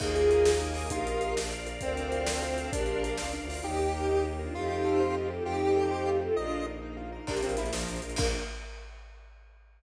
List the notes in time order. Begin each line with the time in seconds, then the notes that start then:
0.00 D#2 A#3 D#4 F4 G#4 A#4 D#5 G#5, kick, crash
0.15 G#4, closed hi-hat
0.30 A#4, closed hi-hat
0.45 G#4, snare
0.61 D#4, closed hi-hat
0.74 G#4, open hi-hat
0.90 A#1 D#4 F4 G4 A#4 D#5 F5, kick, closed hi-hat
1.06 F4, closed hi-hat
1.21 A#4, closed hi-hat
1.36 A#1 D4 A#4 D5 F5, snare
1.52 F4, closed hi-hat
1.67 A#4, closed hi-hat
1.81 D2 C4 A4 A#4 C5 D5 F5, kick, closed hi-hat
1.97 D4, closed hi-hat
2.12 F4, closed hi-hat
2.27 A4, snare
2.42 F4, closed hi-hat
2.58 D4, closed hi-hat
2.72 A#1 D4 G4 A#4 D5 F5, kick, closed hi-hat
2.86 F4, closed hi-hat
3.03 A#4, closed hi-hat
3.17 C#2 F4, snare
3.32 D4, closed hi-hat
3.41 D2
3.49 F4, open hi-hat
3.64 D#2 A#3 D#4 G4
3.79 G4
3.94 A#4
4.09 D#4
4.24 G4
4.39 D4 F4 A#4
4.54 F2 A3 C4 D#4 F4 G4
4.70 G4
4.85 A4
5.00 C5
5.15 F4
5.30 F4 G4 A4
5.45 F2 A3 C4 D#4 F4 G4
5.61 G4
5.76 A4
5.91 C5
6.06 F4
6.21 F4 G4 A4
6.35 A#1 A#3 D4 D#4 F4 D#5
6.52 F4
6.67 A#4
6.82 D#4
6.97 F4
7.12 A#4
7.27 A#1 A#3 D4 F4 G4 A#4, kick, crash
7.37 closed hi-hat
7.42 A#1 C4 D4 F4 A#4, closed hi-hat
7.49 closed hi-hat
7.57 A#1 D4 E4 F4 A#4, closed hi-hat
7.65 D4 F4 A#4, closed hi-hat
7.72 A#1 F3 A#3 D4 F4 A#4, snare
7.80 closed hi-hat
7.88 A#1, closed hi-hat
7.96 closed hi-hat
8.02 A#1, closed hi-hat
8.10 closed hi-hat
8.16 A#1 A#3 D4 F4 A#4, kick, crash